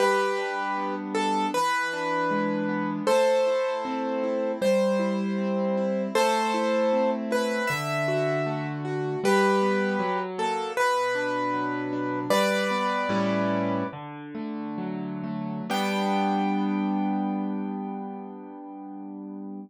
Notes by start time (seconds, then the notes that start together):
0.00 G3 G4 B4
0.38 D4
0.77 B3
1.15 D4 A4
1.54 E3 B4
1.93 D4
2.31 G#3
2.69 B3
3.07 A3 A4 C5
3.47 E4
3.85 C4
4.23 E4
4.62 G3 C5
4.99 E4
5.38 C4
5.77 E4
6.15 A3 A4 C5
6.54 E4
6.93 C4
7.31 E4 B4
7.67 D3 E5
8.08 F#4
8.46 A3
8.85 F#4
9.24 G3 G4 B4
9.62 B3
9.99 F#3
10.38 A#3 A4
10.77 B2 B4
11.15 D4
11.53 F#3
11.93 D4
12.30 G3 B4 D5
12.71 B3
13.09 A2 G3 C#4 E4
13.93 D3
14.35 A3
14.78 F#3
15.24 A3
15.70 G3 B3 D4 G5